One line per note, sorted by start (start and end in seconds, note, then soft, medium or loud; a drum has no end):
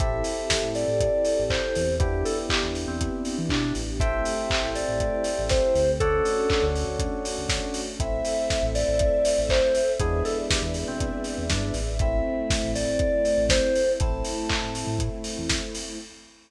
0.00 0.23 A1 medium
0.00 1.79 C4 medium
0.00 1.98 C4 medium
0.00 1.79 E4 medium
0.00 1.98 E4 medium
0.00 1.79 G4 medium
0.00 1.98 G4 medium
0.00 1.79 A4 medium
0.00 1.98 A4 medium
0.00 0.69 E5 medium
0.00 kick loud
0.00 closed hi-hat loud
0.24 open hi-hat medium
0.50 kick medium
0.50 snare loud
0.62 0.85 A2 medium
0.75 1.43 D5 medium
0.75 open hi-hat medium
0.88 1.10 A2 medium
1.00 kick medium
1.00 closed hi-hat loud
1.25 open hi-hat medium
1.39 1.61 A1 medium
1.50 1.95 C5 medium
1.50 kick medium
1.50 clap loud
1.75 2.24 E2 medium
1.75 open hi-hat medium
1.99 3.79 B3 medium
1.99 3.99 B3 medium
1.99 3.79 D4 medium
1.99 3.99 D4 medium
1.99 3.79 E4 medium
1.99 3.99 E4 medium
1.99 3.79 G4 medium
1.99 2.24 G4 loud
1.99 3.99 G4 medium
1.99 kick loud
1.99 closed hi-hat loud
2.25 2.37 A4 medium
2.25 open hi-hat medium
2.49 2.62 G4 medium
2.49 kick medium
2.49 clap loud
2.63 2.86 E2 medium
2.75 open hi-hat medium
2.88 3.10 E2 medium
2.88 3.38 C4 medium
3.01 kick medium
3.01 closed hi-hat loud
3.25 open hi-hat medium
3.38 3.50 E3 medium
3.49 3.73 B2 medium
3.49 3.73 D4 medium
3.49 kick medium
3.49 clap loud
3.75 4.23 A1 medium
3.75 open hi-hat medium
4.00 5.98 A3 medium
4.00 5.98 C4 medium
4.00 5.98 E4 medium
4.00 5.98 G4 medium
4.00 5.80 A4 medium
4.00 5.80 C5 medium
4.00 4.70 E5 medium
4.00 5.80 E5 medium
4.00 5.80 G5 medium
4.00 kick loud
4.00 closed hi-hat loud
4.25 open hi-hat medium
4.50 kick medium
4.50 clap loud
4.62 4.85 A1 medium
4.75 5.43 D5 medium
4.75 open hi-hat medium
4.88 5.11 A1 medium
5.00 kick medium
5.00 closed hi-hat loud
5.24 open hi-hat medium
5.39 5.61 A1 medium
5.49 5.91 C5 medium
5.49 kick medium
5.49 snare medium
5.75 6.22 D2 medium
5.75 open hi-hat medium
6.00 7.98 A3 medium
6.00 7.98 C#4 medium
6.00 7.98 D4 medium
6.00 7.98 F#4 medium
6.00 6.65 A4 loud
6.00 7.81 A4 medium
6.00 7.81 C#5 medium
6.00 7.81 D5 medium
6.00 7.81 F#5 medium
6.00 kick loud
6.00 closed hi-hat loud
6.25 open hi-hat medium
6.50 kick medium
6.50 clap loud
6.62 6.85 D2 medium
6.76 open hi-hat medium
6.87 7.09 D2 medium
6.99 kick medium
6.99 closed hi-hat loud
7.25 open hi-hat medium
7.38 7.60 D2 medium
7.49 kick medium
7.49 snare loud
7.74 open hi-hat medium
7.99 8.22 A1 medium
7.99 9.80 A3 medium
7.99 9.80 C4 medium
7.99 9.80 E4 medium
7.99 9.98 A4 medium
7.99 9.98 C5 medium
7.99 9.98 E5 loud
7.99 8.66 E5 medium
7.99 kick medium
7.99 closed hi-hat loud
8.25 open hi-hat medium
8.50 kick medium
8.50 snare medium
8.62 8.85 A1 medium
8.75 9.39 D5 medium
8.75 open hi-hat medium
8.88 9.11 A1 medium
8.99 kick medium
8.99 closed hi-hat loud
9.25 open hi-hat loud
9.38 9.61 A1 medium
9.49 9.91 C5 medium
9.49 kick medium
9.49 clap loud
9.75 open hi-hat medium
9.99 10.23 E2 medium
9.99 11.80 G#3 medium
9.99 11.80 B3 medium
9.99 11.80 D4 medium
9.99 11.80 E4 medium
9.99 10.23 G#4 loud
9.99 11.98 G#4 medium
9.99 11.98 B4 medium
9.99 11.98 D5 medium
9.99 11.98 E5 medium
9.99 kick loud
9.99 closed hi-hat loud
10.25 10.37 A4 medium
10.25 open hi-hat medium
10.50 10.62 G4 medium
10.50 kick medium
10.50 snare loud
10.62 10.84 E2 medium
10.74 open hi-hat medium
10.88 11.11 B2 medium
10.88 11.44 C4 medium
11.00 kick medium
11.00 closed hi-hat loud
11.24 open hi-hat medium
11.38 11.50 E2 medium
11.50 11.72 G2 medium
11.50 11.73 D4 medium
11.50 kick medium
11.50 snare loud
11.74 12.22 A1 medium
11.74 open hi-hat medium
11.99 13.98 A3 medium
11.99 13.81 A3 medium
11.99 13.98 C4 medium
11.99 13.81 C4 medium
11.99 13.98 E4 medium
11.99 13.81 E4 medium
11.99 12.71 E5 medium
11.99 kick loud
11.99 closed hi-hat medium
12.50 kick loud
12.50 snare loud
12.50 open hi-hat medium
12.63 12.86 A1 medium
12.75 13.44 D5 loud
12.75 open hi-hat medium
12.87 13.09 A1 medium
12.99 kick loud
12.99 closed hi-hat medium
13.25 open hi-hat medium
13.38 13.60 A1 medium
13.49 13.92 C5 medium
13.49 kick medium
13.49 snare loud
13.75 open hi-hat medium
13.99 14.23 A1 medium
13.99 15.97 A3 medium
13.99 15.81 A3 medium
13.99 15.97 C4 medium
13.99 15.81 C4 medium
13.99 15.97 E4 loud
13.99 15.81 E4 medium
13.99 14.98 A5 medium
13.99 kick loud
13.99 closed hi-hat loud
14.24 open hi-hat medium
14.49 kick medium
14.49 clap loud
14.62 14.85 A2 medium
14.75 open hi-hat medium
14.87 15.09 A2 medium
14.99 kick medium
14.99 closed hi-hat loud
15.24 open hi-hat medium
15.38 15.61 E2 medium
15.49 kick medium
15.49 snare loud
15.75 open hi-hat medium